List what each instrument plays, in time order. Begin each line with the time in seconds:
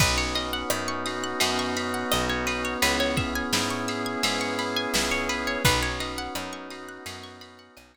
0.00 electric bass (finger) B1, pad 5 (bowed) B3 C#4 D#4 F#4, drawbar organ B3, acoustic guitar (steel) B4, kick, crash
0.18 acoustic guitar (steel) C#5
0.35 drawbar organ C#4, acoustic guitar (steel) D#5, ride
0.53 acoustic guitar (steel) F#5
0.70 electric bass (finger) F#2, drawbar organ D#4, acoustic guitar (steel) B5, cross-stick
0.88 acoustic guitar (steel) C#6
1.06 drawbar organ F#4, acoustic guitar (steel) D#6, ride
1.24 acoustic guitar (steel) F#6
1.40 electric bass (finger) F#2, drawbar organ B3, pad 5 (bowed) B3 C#4 F#4 B4, acoustic guitar (steel) D#6, ride
1.59 acoustic guitar (steel) C#6
1.76 drawbar organ C#4, acoustic guitar (steel) B5, ride
1.94 acoustic guitar (steel) F#5
2.11 electric bass (finger) B1, drawbar organ D#4, acoustic guitar (steel) D#5, cross-stick
2.29 acoustic guitar (steel) C#5
2.47 drawbar organ B3, acoustic guitar (steel) B4, ride
2.65 acoustic guitar (steel) C#5
2.82 electric bass (finger) C#2, pad 5 (bowed) B3 C#4 E4 G#4, acoustic guitar (steel) B4, ride
3.00 acoustic guitar (steel) C#5
3.17 drawbar organ C#4, acoustic guitar (steel) E5, kick, ride
3.35 acoustic guitar (steel) G#5
3.53 electric bass (finger) G#2, drawbar organ E4, acoustic guitar (steel) B5, snare
3.70 acoustic guitar (steel) C#6
3.88 drawbar organ G#4, acoustic guitar (steel) E6, ride
4.06 acoustic guitar (steel) G#6
4.23 electric bass (finger) G#2, pad 5 (bowed) B3 C#4 G#4 B4, drawbar organ B3, acoustic guitar (steel) E6, ride
4.41 acoustic guitar (steel) C#6
4.59 drawbar organ C#4, acoustic guitar (steel) B5, ride
4.76 acoustic guitar (steel) G#5
4.94 electric bass (finger) C#2, drawbar organ E4, acoustic guitar (steel) E5, snare
5.11 acoustic guitar (steel) C#5
5.29 drawbar organ G#4, acoustic guitar (steel) B4, ride
5.47 acoustic guitar (steel) C#5
5.65 electric bass (finger) B1, pad 5 (bowed) B3 C#4 D#4 F#4, drawbar organ B3, acoustic guitar (steel) B4, kick, ride
5.82 acoustic guitar (steel) C#5
6.00 drawbar organ C#4, acoustic guitar (steel) D#5, ride
6.18 acoustic guitar (steel) F#5
6.35 electric bass (finger) F#2, drawbar organ D#4, acoustic guitar (steel) B5, cross-stick
6.53 acoustic guitar (steel) C#6
6.70 drawbar organ F#4, acoustic guitar (steel) D#6, ride
6.89 acoustic guitar (steel) F#6
7.05 electric bass (finger) F#2, pad 5 (bowed) B3 C#4 F#4 B4, drawbar organ B3, acoustic guitar (steel) D#6, ride
7.24 acoustic guitar (steel) C#6
7.41 drawbar organ C#4, acoustic guitar (steel) B5, ride
7.59 acoustic guitar (steel) F#5
7.77 electric bass (finger) B1, drawbar organ D#4, acoustic guitar (steel) D#5, cross-stick
7.94 acoustic guitar (steel) C#5